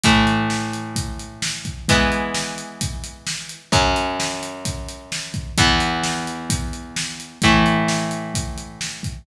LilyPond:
<<
  \new Staff \with { instrumentName = "Overdriven Guitar" } { \time 4/4 \key e \mixolydian \tempo 4 = 130 <a, e a>1 | <e gis b>1 | <fis, fis cis'>1 | <e, e b>1 |
<a, e a>1 | }
  \new DrumStaff \with { instrumentName = "Drums" } \drummode { \time 4/4 <hh bd>8 hh8 sn8 hh8 <hh bd>8 hh8 sn8 <hh bd>8 | <hh bd>8 hh8 sn8 hh8 <hh bd>8 hh8 sn8 hh8 | <hh bd>8 hh8 sn8 hh8 <hh bd>8 hh8 sn8 <hh bd>8 | <hh bd>8 hh8 sn8 hh8 <hh bd>8 hh8 sn8 hh8 |
<hh bd>8 hh8 sn8 hh8 <hh bd>8 hh8 sn8 <hh bd>8 | }
>>